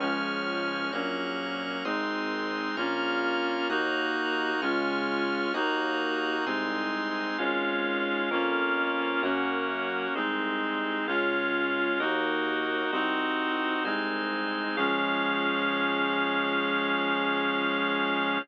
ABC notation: X:1
M:4/4
L:1/8
Q:1/4=65
K:Db
V:1 name="Clarinet"
[F,A,D]2 [G,B,D]2 [A,CE]2 [B,DF]2 | [B,EG]2 [A,DF]2 [B,EG]2 [A,CE]2 | [A,DF]2 [B,DF]2 [B,DG]2 [A,CE]2 | [A,DF]2 [B,EG]2 [CEG]2 [A,CE]2 |
[F,A,D]8 |]
V:2 name="Drawbar Organ"
[ad'f']2 [bd'g']2 [ac'e']2 [bd'f']2 | [be'g']2 [ad'f']2 [be'g']2 [ac'e']2 | [Adf]2 [Bdf]2 [Bdg]2 [Ace]2 | [Adf]2 [Beg]2 [ceg]2 [cea]2 |
[Adf]8 |]
V:3 name="Synth Bass 1" clef=bass
D,,2 B,,,2 A,,,2 B,,,2 | E,,2 D,,2 E,,2 C,,2 | A,,,2 F,,2 G,,2 C,,2 | D,,2 E,,2 C,,2 C,,2 |
D,,8 |]